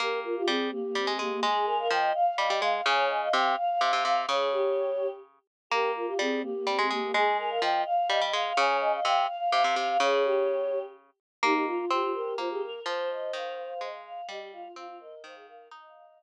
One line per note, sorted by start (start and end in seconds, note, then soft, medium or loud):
0.00 0.43 A#3 loud
0.00 0.19 G4 loud
0.00 0.20 A#4 medium
0.24 0.35 F4 medium
0.24 0.35 A#4 medium
0.36 0.47 F4 loud
0.36 0.47 G4 medium
0.47 0.71 G3 loud
0.47 0.70 C4 loud
0.47 0.69 G#4 medium
0.71 0.82 A#3 loud
0.71 1.13 G4 medium
0.83 0.94 A#3 loud
0.95 1.07 G3 loud
0.95 1.07 C4 loud
1.07 1.18 G#3 loud
1.07 1.19 C4 loud
1.19 1.40 G#3 medium
1.19 1.31 A#3 loud
1.19 1.42 G4 medium
1.32 1.43 A#3 loud
1.43 1.88 G#3 loud
1.43 1.66 G#4 loud
1.43 1.66 G#5 medium
1.66 1.77 A#4 loud
1.66 1.78 G#5 medium
1.79 1.90 A#4 loud
1.79 1.90 F5 medium
1.90 2.13 F3 loud
1.90 2.12 D#5 loud
1.90 2.11 G5 medium
2.14 2.52 F5 medium
2.14 2.25 F5 loud
2.26 2.37 F5 loud
2.37 2.49 G3 loud
2.37 2.49 D#5 loud
2.49 2.61 G3 medium
2.49 2.61 D#5 loud
2.62 2.81 G#3 loud
2.62 2.84 F5 medium
2.62 2.73 F5 loud
2.74 2.85 F5 loud
2.85 3.29 C#3 loud
2.85 3.08 C#5 loud
2.85 3.05 G#5 medium
3.09 3.20 D#5 loud
3.09 3.21 G#5 medium
3.22 3.34 D#5 loud
3.22 3.33 F5 medium
3.33 3.56 C3 loud
3.33 3.55 F5 loud
3.33 3.54 G5 medium
3.57 3.68 F5 loud
3.57 4.03 F5 medium
3.70 3.80 F5 loud
3.81 3.92 C3 loud
3.81 3.92 F5 loud
3.92 4.04 C3 medium
3.92 4.04 F5 loud
4.05 4.26 C3 medium
4.05 4.27 F5 medium
4.05 4.16 F5 loud
4.16 4.28 F5 loud
4.27 5.39 C#3 loud
4.27 4.48 G#4 loud
4.27 5.07 C#5 medium
4.52 5.10 G4 loud
5.70 6.14 A#3 loud
5.70 5.90 G4 loud
5.70 5.91 A#4 medium
5.95 6.06 F4 medium
5.95 6.07 A#4 medium
6.07 6.18 F4 loud
6.07 6.18 G4 medium
6.19 6.42 G3 loud
6.19 6.43 C4 loud
6.19 6.40 G#4 medium
6.42 6.53 A#3 loud
6.42 6.86 G4 medium
6.55 6.67 A#3 loud
6.67 6.78 G3 loud
6.67 6.77 C4 loud
6.78 6.90 G#3 loud
6.78 6.89 C4 loud
6.90 7.12 G#3 medium
6.90 7.01 A#3 loud
6.90 7.13 G4 medium
7.02 7.13 A#3 loud
7.14 7.59 G#3 loud
7.14 7.37 G#4 loud
7.14 7.37 G#5 medium
7.38 7.50 A#4 loud
7.38 7.50 G#5 medium
7.50 7.63 A#4 loud
7.50 7.61 F5 medium
7.61 7.84 F3 loud
7.61 7.82 D#5 loud
7.61 7.82 G5 medium
7.85 7.96 F5 loud
7.85 8.24 F5 medium
7.97 8.08 F5 loud
8.09 8.21 G3 loud
8.09 8.20 D#5 loud
8.21 8.33 G3 medium
8.21 8.33 D#5 loud
8.33 8.53 G#3 loud
8.33 8.55 F5 medium
8.33 8.45 F5 loud
8.46 8.57 F5 loud
8.57 9.00 C#3 loud
8.57 8.79 C#5 loud
8.57 8.77 G#5 medium
8.81 8.92 D#5 loud
8.81 8.92 G#5 medium
8.93 9.04 D#5 loud
8.93 9.04 F5 medium
9.05 9.27 C3 loud
9.05 9.27 F5 loud
9.05 9.26 G5 medium
9.27 9.39 F5 loud
9.27 9.75 F5 medium
9.40 9.51 F5 loud
9.52 9.64 C3 loud
9.52 9.63 F5 loud
9.63 9.76 C3 medium
9.63 9.74 F5 loud
9.76 9.97 C3 medium
9.76 9.98 F5 medium
9.76 9.88 F5 loud
9.89 10.00 F5 loud
10.00 11.10 C#3 loud
10.00 10.22 G#4 loud
10.00 10.79 C#5 medium
10.25 10.82 G4 loud
11.43 11.85 A#3 loud
11.43 11.65 D#4 loud
11.43 11.54 G4 medium
11.54 11.66 G4 medium
11.66 11.85 F4 loud
11.66 11.78 F4 medium
11.79 11.90 F4 medium
11.90 12.34 C4 loud
11.90 12.02 F4 medium
11.90 12.11 G4 loud
12.02 12.14 F4 medium
12.14 12.35 G4 loud
12.14 12.36 A#4 medium
12.38 12.80 A#3 medium
12.38 12.49 F4 loud
12.38 12.49 C5 medium
12.50 12.62 G4 loud
12.50 12.62 G#4 medium
12.62 12.81 A#4 medium
12.62 12.82 A#4 loud
12.86 13.32 F3 loud
12.86 13.88 C5 medium
12.86 13.09 C5 loud
13.10 13.31 D#5 loud
13.33 13.74 D#3 loud
13.33 13.57 F5 loud
13.58 13.81 F5 loud
13.81 14.21 G#3 medium
13.81 13.92 D#5 loud
13.93 14.04 F5 medium
14.05 14.27 F5 loud
14.29 14.68 G3 loud
14.29 14.40 G4 medium
14.29 14.52 D#5 loud
14.40 14.52 G4 medium
14.53 14.64 F4 medium
14.53 14.72 F5 loud
14.64 14.76 F4 medium
14.76 15.15 C4 loud
14.76 14.87 F4 medium
14.76 14.97 F5 loud
14.88 14.99 F4 medium
15.00 15.22 A#4 medium
15.00 15.23 D#5 loud
15.24 15.69 D#3 loud
15.24 15.35 C5 medium
15.24 15.35 F5 loud
15.35 15.47 G#4 medium
15.35 15.46 F5 medium
15.47 15.68 A#4 medium
15.47 15.68 F5 loud
15.71 16.23 D#4 loud
15.71 16.23 D#5 medium
15.71 15.83 D#5 loud
15.83 15.95 F5 loud
15.95 16.06 F5 loud
16.06 16.23 F5 loud